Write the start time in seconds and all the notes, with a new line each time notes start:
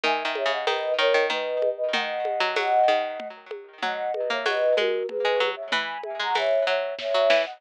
0.04 D#3 E5 G#5, low conga
0.25 D#3
0.35 C#5 E5, high conga
0.46 C#3
0.51 D#5 F#5
0.67 D#3 B4 D#5, tambourine, high conga
0.98 D#3 A#4 C#5
1.14 D#3
1.30 D#3 B4 D#5, low conga
1.62 high conga
1.77 B4 D#5
1.93 D#3 D#5 F#5, low conga
2.25 high conga
2.40 F#3
2.56 F#3, tambourine, high conga
2.88 D#3, high conga
3.20 low conga
3.51 high conga
3.83 F#3 D#5 F#5, low conga
4.14 B4 D#5, high conga
4.30 A#3 C#5 E5
4.46 F#3 B4 D#5, tambourine, high conga
4.77 G#3 F#4 A#4, high conga
5.09 G#4 B4, low conga
5.25 G#3
5.40 F#3, high conga
5.56 C#5 E5
5.72 E3 G#5 B5, low conga
6.03 E5 G#5, high conga
6.19 G#3 F#5 A#5
6.35 E3 C#5 E5, tambourine, high conga
6.67 F#3 C#5 E5
6.99 C#5 E5, kick, snare
7.14 F#3
7.30 E3, snare
7.46 D#5 F#5